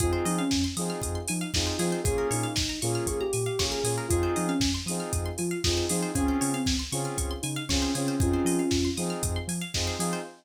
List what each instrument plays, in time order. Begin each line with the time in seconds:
0.00 synth bass 2 F2, lead 2 (sawtooth) C4 D#4 F4 G#4, ocarina F4, pizzicato strings G#4, kick, closed hi-hat
0.13 pizzicato strings C5
0.25 synth bass 2 F3, ocarina D#4, pizzicato strings D#5, open hi-hat
0.38 ocarina C#4, pizzicato strings F5
0.51 synth bass 2 F2, pizzicato strings G#5, kick, snare
0.64 pizzicato strings C6
0.77 synth bass 2 F3, lead 2 (sawtooth) C4 D#4 F4 G#4, pizzicato strings D#6, open hi-hat
0.90 pizzicato strings F6
1.01 synth bass 2 F2, pizzicato strings D#6, kick, closed hi-hat
1.15 pizzicato strings C6
1.28 synth bass 2 F3, ocarina D#4, pizzicato strings G#5, open hi-hat
1.41 pizzicato strings F5
1.54 synth bass 2 F2, lead 2 (sawtooth) C4 D#4 F4 G#4, ocarina D#4, pizzicato strings D#5, kick, snare
1.67 pizzicato strings C5
1.79 synth bass 2 F3, lead 2 (sawtooth) C4 D#4 F4 G#4, ocarina F4, pizzicato strings G#4, open hi-hat
1.92 pizzicato strings C5
2.03 synth bass 2 A#1, lead 2 (sawtooth) A#3 C#4 F4 G#4, ocarina G#4, pizzicato strings G#4, kick, closed hi-hat
2.18 pizzicato strings A#4
2.31 synth bass 2 A#2, ocarina D#4, pizzicato strings C#5, open hi-hat
2.43 pizzicato strings F5
2.56 synth bass 2 A#1, pizzicato strings G#5, kick, snare
2.69 pizzicato strings A#5
2.82 synth bass 2 A#2, lead 2 (sawtooth) A#3 C#4 F4 G#4, ocarina F4, pizzicato strings C#6, open hi-hat
2.95 pizzicato strings F6
3.06 synth bass 2 A#1, ocarina G#4, pizzicato strings C#6, kick, closed hi-hat
3.20 ocarina G4, pizzicato strings A#5
3.33 synth bass 2 A#2, pizzicato strings G#5, open hi-hat
3.46 pizzicato strings F5
3.59 synth bass 2 A#1, lead 2 (sawtooth) A#3 C#4 F4 G#4, pizzicato strings C#5, kick, snare
3.71 ocarina G#4, pizzicato strings A#4
3.84 synth bass 2 A#2, lead 2 (sawtooth) A#3 C#4 F4 G#4, pizzicato strings G#4, open hi-hat
3.98 pizzicato strings A#4
4.09 synth bass 2 F2, lead 2 (sawtooth) C4 D#4 F4 G#4, ocarina F4, pizzicato strings G#4, kick, closed hi-hat
4.23 pizzicato strings C5
4.36 synth bass 2 F3, ocarina D#4, pizzicato strings D#5, open hi-hat
4.48 ocarina C#4, pizzicato strings F5
4.60 synth bass 2 F2, pizzicato strings G#5, kick, snare
4.74 pizzicato strings C6
4.86 synth bass 2 F3, lead 2 (sawtooth) C4 D#4 F4 G#4, pizzicato strings D#6, open hi-hat
5.00 pizzicato strings F6
5.13 synth bass 2 F2, pizzicato strings D#6, kick, closed hi-hat
5.26 pizzicato strings C6
5.38 synth bass 2 F3, ocarina F4, pizzicato strings G#5, open hi-hat
5.51 pizzicato strings F5
5.64 synth bass 2 F2, lead 2 (sawtooth) C4 D#4 F4 G#4, ocarina F4, pizzicato strings D#5, kick, snare
5.77 pizzicato strings C5
5.89 synth bass 2 F3, lead 2 (sawtooth) C4 D#4 F4 G#4, ocarina D#4, pizzicato strings G#4, open hi-hat
6.03 pizzicato strings C5
6.15 synth bass 2 C#2, lead 2 (sawtooth) C4 C#4 F4 G#4, ocarina C#4, pizzicato strings G#4, kick, closed hi-hat
6.28 pizzicato strings C5
6.41 synth bass 2 C#3, ocarina C#4, pizzicato strings C#5, open hi-hat
6.53 ocarina C4, pizzicato strings F5
6.66 synth bass 2 C#2, pizzicato strings G#5, kick, snare
6.79 pizzicato strings C6
6.92 synth bass 2 C#3, lead 2 (sawtooth) C4 C#4 F4 G#4, pizzicato strings C#6, open hi-hat
7.05 pizzicato strings F6
7.18 synth bass 2 C#2, pizzicato strings C#6, kick, closed hi-hat
7.31 pizzicato strings C6
7.42 synth bass 2 C#3, ocarina D#4, pizzicato strings G#5, open hi-hat
7.56 pizzicato strings F5
7.69 synth bass 2 C#2, lead 2 (sawtooth) C4 C#4 F4 G#4, ocarina C#4, pizzicato strings C#5, kick, snare
7.82 pizzicato strings C5
7.95 synth bass 2 C#3, lead 2 (sawtooth) C4 C#4 F4 G#4, ocarina C#4, pizzicato strings G#4, open hi-hat
8.08 pizzicato strings C5
8.20 synth bass 2 F2, lead 2 (sawtooth) C4 D#4 F4 G#4, ocarina C#4 F4, pizzicato strings G#4, kick, closed hi-hat
8.33 pizzicato strings C5
8.45 synth bass 2 F3, pizzicato strings D#5, open hi-hat
8.59 pizzicato strings F5
8.71 synth bass 2 F2, pizzicato strings G#5, kick, snare
8.85 pizzicato strings C6
8.97 synth bass 2 F3, lead 2 (sawtooth) C4 D#4 F4 G#4, pizzicato strings D#6, open hi-hat
9.10 pizzicato strings F6
9.23 synth bass 2 F2, pizzicato strings D#6, kick, closed hi-hat
9.36 pizzicato strings C6
9.48 synth bass 2 F3, pizzicato strings G#5, open hi-hat
9.61 pizzicato strings F5
9.74 synth bass 2 F2, lead 2 (sawtooth) C4 D#4 F4 G#4, pizzicato strings D#5, kick, snare
9.87 pizzicato strings C5
9.99 synth bass 2 F3, lead 2 (sawtooth) C4 D#4 F4 G#4, pizzicato strings G#4, open hi-hat
10.13 pizzicato strings C5